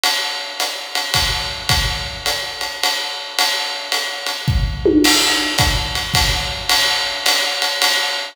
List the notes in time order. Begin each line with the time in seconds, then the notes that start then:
0.03 ride
0.60 hi-hat pedal, ride
0.95 ride
1.14 kick, ride
1.69 kick, ride
2.26 hi-hat pedal, ride
2.61 ride
2.83 ride
3.39 ride
3.92 hi-hat pedal, ride
4.26 ride
4.48 kick
4.86 high tom
5.04 crash, ride
5.58 kick, hi-hat pedal, ride
5.95 ride
6.14 kick, ride
6.69 ride
7.26 hi-hat pedal, ride
7.62 ride
7.82 ride